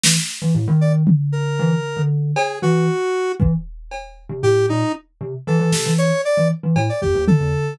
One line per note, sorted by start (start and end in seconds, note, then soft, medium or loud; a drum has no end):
0.03 0.15 E3 medium
0.03 snare loud
0.42 0.53 E3 medium
0.55 0.66 A2 medium
0.68 1.03 D#3 loud
0.81 0.93 D5 medium
1.07 floor tom loud
1.32 2.02 A#4 medium
1.59 1.71 E3 loud
1.97 2.32 D3 medium
2.36 2.59 G#4 medium
2.36 cowbell loud
2.62 2.86 E3 medium
2.62 3.32 F#4 loud
3.40 3.51 E3 medium
3.40 kick medium
3.91 cowbell medium
4.29 4.41 C3 medium
4.43 4.66 A2 medium
4.43 4.66 G4 loud
4.69 4.81 A#2 medium
4.69 4.92 D#4 loud
5.21 5.32 C3 medium
5.47 5.59 E3 loud
5.47 5.94 A4 medium
5.59 5.71 E3 medium
5.72 5.84 C3 medium
5.72 snare medium
5.85 6.09 E3 medium
5.98 6.21 C#5 medium
5.98 closed hi-hat medium
6.25 6.48 D5 medium
6.37 6.49 E3 medium
6.63 6.75 E3 medium
6.76 6.88 A2 loud
6.76 cowbell loud
6.89 7.01 D5 medium
7.02 7.14 F2 soft
7.02 7.25 G4 medium
7.02 kick medium
7.15 7.26 D#2 loud
7.27 7.74 A4 medium
7.27 floor tom loud
7.40 7.52 E2 loud